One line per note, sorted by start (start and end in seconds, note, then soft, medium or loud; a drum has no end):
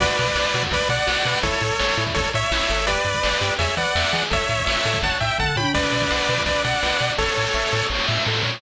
0.00 0.09 B1 medium
0.00 0.17 F#4 loud
0.00 0.63 B4 medium
0.00 0.63 D5 medium
0.00 kick medium
0.00 crash medium
0.09 closed hi-hat medium
0.18 0.29 B2 medium
0.18 0.34 B4 medium
0.18 closed hi-hat medium
0.26 kick medium
0.26 closed hi-hat medium
0.35 0.45 B1 medium
0.35 0.52 D5 medium
0.35 snare loud
0.45 closed hi-hat medium
0.54 0.64 B2 medium
0.54 0.71 F#4 medium
0.54 closed hi-hat medium
0.63 kick medium
0.63 closed hi-hat medium
0.71 0.81 B1 medium
0.71 0.89 B4 medium
0.71 0.88 B4 medium
0.71 0.88 D5 medium
0.71 kick medium
0.71 closed hi-hat loud
0.81 closed hi-hat medium
0.89 0.99 B2 medium
0.89 1.39 D5 medium
0.89 1.07 D5 medium
0.89 1.39 F#5 medium
0.89 closed hi-hat medium
0.99 closed hi-hat medium
1.07 1.17 B1 medium
1.07 1.23 F#4 medium
1.07 snare loud
1.16 closed hi-hat medium
1.25 1.35 B2 medium
1.25 1.42 B4 medium
1.25 closed hi-hat medium
1.35 open hi-hat medium
1.43 1.53 A1 medium
1.43 1.60 E4 medium
1.43 2.04 A4 medium
1.43 2.04 C#5 medium
1.43 kick loud
1.43 closed hi-hat medium
1.53 closed hi-hat medium
1.61 1.72 A2 medium
1.61 1.77 A4 medium
1.61 closed hi-hat medium
1.71 closed hi-hat medium
1.79 1.90 A1 medium
1.79 1.96 C#5 medium
1.79 snare medium
1.89 closed hi-hat medium
1.97 2.07 A2 medium
1.97 2.14 E4 medium
1.97 closed hi-hat medium
2.06 kick medium
2.06 closed hi-hat medium
2.14 2.26 A1 medium
2.14 2.30 A4 medium
2.14 2.32 A4 medium
2.14 2.30 C#5 medium
2.14 kick medium
2.14 closed hi-hat medium
2.24 closed hi-hat medium
2.33 2.44 A2 medium
2.33 2.50 C#5 medium
2.33 2.86 C#5 medium
2.33 2.86 E5 medium
2.33 closed hi-hat medium
2.43 closed hi-hat medium
2.51 2.61 A1 medium
2.51 2.68 E4 medium
2.51 snare loud
2.60 closed hi-hat medium
2.69 2.98 G1 medium
2.69 2.86 A4 medium
2.69 closed hi-hat medium
2.78 closed hi-hat medium
2.87 3.04 G4 loud
2.87 3.54 B4 medium
2.87 3.54 D5 medium
2.87 kick medium
2.87 closed hi-hat loud
2.97 closed hi-hat medium
3.05 3.15 G2 medium
3.05 3.22 B4 medium
3.05 closed hi-hat medium
3.14 kick medium
3.14 closed hi-hat medium
3.23 3.34 G1 medium
3.23 3.39 D5 medium
3.23 snare loud
3.32 closed hi-hat medium
3.41 3.51 G2 medium
3.41 3.57 G4 medium
3.41 closed hi-hat medium
3.50 closed hi-hat medium
3.58 3.69 E2 medium
3.58 3.76 G#4 medium
3.58 3.75 C#5 medium
3.58 3.75 E5 medium
3.58 kick medium
3.58 closed hi-hat loud
3.69 closed hi-hat medium
3.77 3.87 E3 medium
3.77 3.94 B4 medium
3.77 4.24 D5 medium
3.77 4.24 F#5 medium
3.77 closed hi-hat medium
3.85 closed hi-hat medium
3.95 4.05 E2 medium
3.95 4.11 E5 medium
3.95 snare loud
4.04 closed hi-hat medium
4.13 4.23 E3 medium
4.13 4.29 G#4 medium
4.13 closed hi-hat medium
4.22 closed hi-hat medium
4.30 4.41 A1 medium
4.30 4.46 A4 loud
4.30 4.65 C#5 medium
4.30 4.65 E5 medium
4.30 kick loud
4.30 closed hi-hat medium
4.41 closed hi-hat medium
4.49 4.59 A2 medium
4.49 4.65 C#5 medium
4.49 closed hi-hat medium
4.58 kick medium
4.58 closed hi-hat medium
4.66 4.77 A1 medium
4.66 4.99 C#5 medium
4.66 4.99 E5 medium
4.66 4.83 E5 medium
4.66 snare loud
4.76 closed hi-hat medium
4.85 4.95 A2 medium
4.85 5.01 A4 medium
4.85 closed hi-hat medium
4.94 kick medium
4.94 closed hi-hat medium
5.02 5.12 A1 medium
5.02 5.19 C#5 medium
5.02 5.18 F#5 medium
5.02 5.18 A5 medium
5.02 kick medium
5.02 closed hi-hat medium
5.12 closed hi-hat medium
5.20 5.31 A2 medium
5.20 5.38 E5 medium
5.20 5.37 E5 medium
5.20 5.38 G5 medium
5.20 closed hi-hat medium
5.30 closed hi-hat medium
5.38 5.50 A1 medium
5.38 5.55 A4 medium
5.38 5.56 F#5 medium
5.38 5.56 A5 medium
5.38 kick medium
5.38 floor tom medium
5.56 5.66 A2 medium
5.56 5.73 C#5 medium
5.56 5.72 G5 medium
5.56 5.72 B5 medium
5.56 high tom medium
5.74 5.85 B1 medium
5.74 5.90 B4 loud
5.74 6.43 B4 medium
5.74 6.43 D5 medium
5.74 kick loud
5.74 crash medium
5.83 closed hi-hat medium
5.92 6.03 B2 medium
5.92 6.09 D5 medium
5.92 closed hi-hat medium
6.02 kick medium
6.02 closed hi-hat medium
6.11 6.21 B1 medium
6.11 6.27 F#5 medium
6.11 snare loud
6.19 closed hi-hat medium
6.29 6.39 B2 medium
6.29 6.45 B4 medium
6.29 closed hi-hat medium
6.37 kick medium
6.37 closed hi-hat medium
6.46 6.56 B1 medium
6.46 6.62 B4 medium
6.46 6.62 D5 medium
6.46 6.63 D5 medium
6.46 kick medium
6.46 closed hi-hat loud
6.56 closed hi-hat medium
6.64 6.74 B2 medium
6.64 7.12 D5 medium
6.64 7.12 F#5 medium
6.64 6.81 F#5 medium
6.64 closed hi-hat medium
6.73 closed hi-hat medium
6.83 6.93 B1 medium
6.83 6.99 B4 medium
6.83 snare medium
6.91 closed hi-hat medium
7.00 7.11 B2 medium
7.00 7.16 D5 medium
7.00 closed hi-hat medium
7.10 open hi-hat medium
7.18 7.29 A1 medium
7.18 7.34 A4 medium
7.18 7.87 A4 medium
7.18 7.87 C#5 medium
7.18 kick medium
7.18 snare medium
7.28 snare medium
7.36 7.48 A2 medium
7.36 7.53 C#5 medium
7.36 snare medium
7.45 snare medium
7.54 7.64 A1 medium
7.54 7.70 E5 medium
7.54 snare medium
7.63 snare medium
7.72 7.83 A2 medium
7.72 7.89 A4 medium
7.72 snare medium
7.81 snare medium
7.90 8.00 A1 medium
7.90 8.06 C#5 medium
7.90 snare medium
7.95 snare medium
7.99 snare medium
8.04 8.24 E5 medium
8.04 snare medium
8.08 8.19 A2 medium
8.08 snare medium
8.13 snare medium
8.17 snare medium
8.22 snare medium
8.26 8.43 A2 medium
8.26 8.43 A4 medium
8.26 snare medium
8.32 snare medium
8.35 snare medium
8.39 snare medium
8.43 8.59 A#2 medium
8.43 8.60 C#5 medium
8.43 snare medium
8.49 snare medium
8.53 snare medium
8.57 snare loud